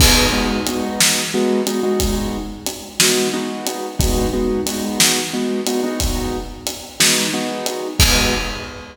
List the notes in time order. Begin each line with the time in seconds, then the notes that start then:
0.00 G#3 B3 D#4 F#4, kick, crash
0.33 G#3 B3 D#4 F#4
0.67 G#3 B3 D#4 F#4, closed hi-hat
1.00 snare
1.34 G#3 B3 D#4 F#4
1.67 G#3 B3 D#4 F#4, closed hi-hat
1.83 G#3 B3 D#4 F#4
2.00 kick, closed hi-hat
2.67 closed hi-hat
3.00 G#3 B3 D#4 F#4, snare
3.33 G#3 B3 D#4 F#4
3.67 closed hi-hat
3.99 G#3 B3 D#4 F#4, kick, closed hi-hat
4.33 G#3 B3 D#4 F#4
4.66 G#3 B3 D#4 F#4, closed hi-hat
5.00 snare
5.33 G#3 B3 D#4 F#4
5.67 G#3 B3 D#4 F#4, closed hi-hat
5.84 G#3 B3 D#4 F#4
6.00 kick, closed hi-hat
6.67 closed hi-hat
7.00 G#3 B3 D#4 F#4, snare
7.33 G#3 B3 D#4 F#4
7.66 closed hi-hat
7.99 G#3 B3 D#4 F#4, kick, crash